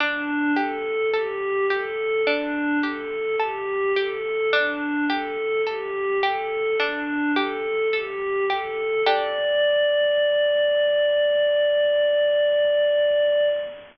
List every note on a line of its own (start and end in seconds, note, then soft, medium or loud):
0.00 0.52 D4 medium
0.00 0.51 D4 loud
0.56 1.07 G4 medium
0.56 1.09 A4 medium
1.13 1.65 G4 medium
1.13 1.64 A4 medium
1.70 2.21 G4 medium
1.70 2.22 A4 medium
2.26 2.79 D4 medium
2.26 2.78 D4 loud
2.83 3.34 G4 medium
2.83 3.35 A4 medium
3.39 3.92 G4 medium
3.39 3.90 A4 medium
3.96 4.47 G4 medium
3.96 4.48 A4 medium
4.53 5.04 D4 loud
4.53 5.05 D4 medium
5.09 5.60 G4 medium
5.09 5.62 A4 medium
5.66 6.18 G4 medium
5.66 6.17 A4 medium
6.23 6.74 G4 medium
6.23 6.75 A4 medium
6.79 7.31 D4 medium
6.79 7.30 D4 loud
7.36 7.87 G4 medium
7.36 7.88 A4 medium
7.92 8.45 G4 medium
7.92 8.44 A4 medium
8.49 9.01 G4 medium
8.49 9.01 A4 medium
9.06 13.49 D4 loud
9.06 13.49 G4 loud
9.06 13.49 A4 medium
9.06 13.48 D5 loud